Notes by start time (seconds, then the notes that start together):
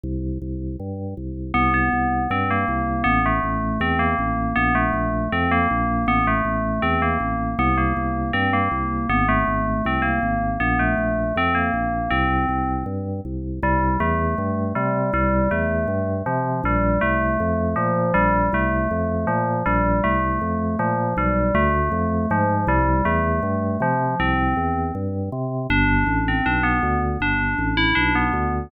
0.03 C2
0.42 C2
0.80 G2
1.17 C2
1.54 C2 B3
1.74 B3
1.93 C2
2.30 G2 C4
2.51 A#3
2.68 C2
3.04 A1 B3
3.26 A3
3.43 A1
3.80 E2 C4
3.99 A#3
4.19 A1
4.56 A#1 B3
4.75 A3
4.93 A#1
5.32 F2 C4
5.51 A#3
5.70 A#1
6.07 A1 B3
6.27 A3
6.45 A1
6.82 E2 C4
7.02 A#3
7.20 A1
7.59 C2 B3
7.78 A#3
7.97 C2
8.33 G2 C4
8.53 A#3
8.71 C2
9.09 G#1 B3
9.29 A3
9.47 G#1
9.85 C2 C4
10.02 A#3
10.23 G#1
10.60 A#1 B3
10.79 A3
10.98 A#1
11.36 F2 C4
11.55 A#3
11.74 A#1
12.10 C2 C4
12.49 C2
12.86 G2
13.25 C2
13.62 C2 G3
14.00 E2 A3
14.38 G2
14.75 C3 G3
15.13 C2 G3
15.51 E2 A3
15.88 G2
16.26 C3 F3
16.64 A#1 G3
17.01 C2 A3
17.40 F2
17.76 A#2 F3
18.14 A#1 G3
18.53 C2 A3
18.91 F2
19.27 A#2 F3
19.66 A#1 G3
20.04 C2 A3
20.41 F2
20.79 A#2 F3
21.17 B1 G3
21.54 D2 A3
21.92 F2
22.30 G#2 F3
22.67 C2 G3
23.05 E2 A3
23.43 G2
23.80 C3 F3
24.20 C2 C4
24.57 E2
24.95 G2
25.32 C3
25.70 G1 D4
26.07 A1
26.28 C4
26.46 B1 D4
26.63 B3
26.83 D2
27.20 G1 D4
27.58 A1
27.77 E4
27.95 B1 D4
28.15 B3
28.33 D2